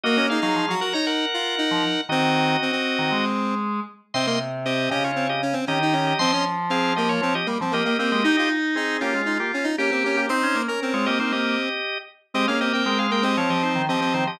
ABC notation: X:1
M:4/4
L:1/16
Q:1/4=117
K:Db
V:1 name="Drawbar Organ"
[Ge]2 [Af] [Af]3 [Bg] [db] [Bg]8 | [Ge]10 z6 | [K:Ab] [ec'] [ec'] z2 [Ge]2 [Ge] [Fd]2 [Ge] z2 [Ge] [Ge] [Ge] [Ge] | [ec'] [ec'] z2 [Af]2 [Ge] [Fd]2 [Ge] z2 [Ge] [Ge] [Ge] [Ge] |
[Ge] [Ge] z2 [CA]2 [B,G] [A,F]2 [B,G] z2 [B,G] [B,G] [B,G] [B,G] | [Ec]3 [DB]2 [Fd] [Ge] [Ec] [Ge]6 z2 | [Ge] [Af] [Ge] [Bg] [Bg] [Af] [Bg] [Ge] [Fd] [Ge] [Ec]2 [Ge]2 [Ec] [Ge] |]
V:2 name="Lead 1 (square)"
B, D E E2 G G E3 F2 E4 | C4 C C7 z4 | [K:Ab] C B, z2 C2 D2 C z D C D E D2 | C D z2 C2 B,2 C z B, C B, B, B,2 |
E F z2 E2 D2 E z D E D C D2 | c3 B C8 z4 | C D C C3 B, C5 C C2 z |]
V:3 name="Drawbar Organ"
B,3 G, F, G, z7 F, z2 | E,4 z3 E, A,6 z2 | [K:Ab] C,6 D,6 E,4 | F,8 F, z G, F, B,2 C A, |
E6 F6 G4 | C D B, z2 A, B, B, B,2 z6 | A, B,3 A,4 F, F,2 E, F, F, E, F, |]